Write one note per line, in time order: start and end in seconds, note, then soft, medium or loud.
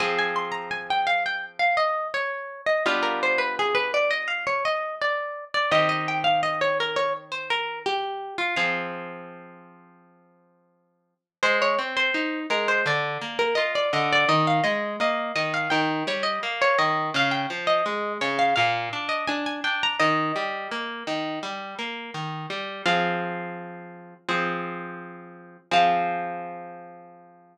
0.00 2.57 F3 medium
0.00 2.57 C4 medium
0.00 2.57 G#4 medium
0.00 0.17 G#5 medium
0.19 0.36 G#5 medium
0.36 0.53 C6 medium
0.52 0.69 A#5 medium
0.71 0.88 G#5 medium
0.90 1.07 G5 medium
1.07 1.24 F5 medium
1.26 1.43 G5 medium
1.59 1.76 F5 medium
1.77 2.08 D#5 medium
2.14 2.61 C#5 medium
2.66 2.83 D#5 medium
2.86 5.43 G3 medium
2.86 5.43 B3 medium
2.86 5.43 D4 medium
2.86 5.43 F4 medium
2.86 3.03 F5 medium
3.03 3.20 A#4 medium
3.23 3.40 C5 medium
3.38 3.55 B4 medium
3.59 3.76 G#4 medium
3.75 3.92 B4 medium
3.94 4.11 D5 medium
4.11 4.28 D#5 medium
4.28 4.45 F5 medium
4.47 4.64 C#5 medium
4.65 4.95 D#5 medium
5.01 5.45 D5 medium
5.54 5.71 D5 medium
5.71 8.29 D#3 medium
5.71 8.29 C4 medium
5.71 8.29 G4 medium
5.71 5.89 D#5 medium
5.89 6.06 D#5 medium
6.08 6.25 G5 medium
6.24 6.41 F5 medium
6.43 6.60 D#5 medium
6.61 6.78 C#5 medium
6.80 6.97 A#4 medium
6.96 7.13 C#5 medium
7.32 7.49 C5 medium
7.50 7.79 A#4 medium
7.86 8.34 G4 medium
8.38 8.55 F4 medium
8.56 11.14 F3 medium
8.56 11.14 C4 medium
8.56 11.14 G#4 medium
8.56 9.51 F5 medium
11.43 11.75 G#3 loud
11.43 11.60 C5 loud
11.62 11.79 C#5 loud
11.79 12.11 C4 medium
11.97 12.40 C5 medium
12.14 12.46 D#4 medium
12.50 12.82 G#3 medium
12.50 12.68 A#4 medium
12.68 12.85 C5 medium
12.86 13.18 D3 loud
12.86 13.38 D5 medium
13.21 13.54 A#3 medium
13.39 13.56 A#4 medium
13.55 13.89 F4 medium
13.55 13.72 D#5 medium
13.75 13.92 D5 medium
13.93 14.25 D3 loud
13.93 14.10 D#5 medium
14.13 14.29 D5 loud
14.29 14.61 D#3 loud
14.29 14.46 D#5 medium
14.47 14.64 F5 medium
14.64 14.96 G#3 medium
14.64 14.94 D#5 medium
15.00 15.32 A#3 loud
15.00 15.32 D#5 medium
15.36 15.68 D#3 medium
15.36 15.53 D#5 medium
15.54 15.71 F5 medium
15.70 16.04 D#3 loud
15.70 16.03 G5 medium
16.07 16.39 G3 medium
16.07 16.25 C#5 medium
16.23 16.40 D#5 medium
16.43 16.75 A#3 medium
16.62 16.79 C#5 loud
16.79 17.11 D#3 medium
16.79 17.09 D#5 medium
17.14 17.46 C#3 loud
17.14 17.33 F5 loud
17.31 17.48 G5 medium
17.50 17.82 F3 medium
17.67 18.13 D#5 medium
17.86 18.18 G#3 medium
18.21 18.54 C#3 loud
18.21 18.38 C#5 medium
18.39 18.55 F5 loud
18.56 18.89 A#2 loud
18.56 19.07 F5 medium
18.93 19.25 D4 medium
19.09 19.26 D#5 medium
19.28 19.61 D4 loud
19.28 19.44 G#5 medium
19.46 19.63 G#5 medium
19.64 19.96 D4 medium
19.64 19.81 G5 medium
19.83 20.00 A#5 loud
20.00 20.32 D#3 loud
20.00 20.86 D#5 loud
20.36 20.68 G3 medium
20.71 21.04 A#3 medium
21.07 21.39 D#3 medium
21.43 21.75 G3 medium
21.79 22.11 A#3 medium
22.14 22.46 D#3 medium
22.50 22.82 G3 medium
22.86 24.14 F3 loud
22.86 24.14 C4 medium
22.86 24.14 G#4 medium
22.86 23.75 F5 medium
24.29 25.57 F3 medium
24.29 25.57 C4 medium
24.29 25.57 G#4 medium
25.71 27.58 F3 loud
25.71 27.58 C4 medium
25.71 27.58 G#4 loud
25.71 27.58 F5 loud